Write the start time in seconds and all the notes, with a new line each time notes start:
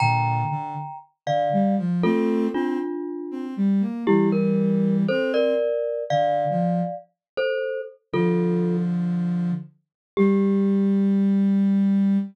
0.00 A#2 D3 G5 A#5
0.51 D3
1.26 D3 D5 F5
1.52 G3
1.77 F3
2.03 A3 C4 F4 A4
2.54 C4 D4 F4
3.31 C4
3.56 G3
3.80 A#3
4.07 E3 G3 E4 G4
4.32 A#4
5.08 C4 A4 C5
5.34 A#4 D5
6.10 D3 D5 F5
6.50 F3
7.37 A4 C5
8.13 D3 F3 F4 A4
10.17 G3 G4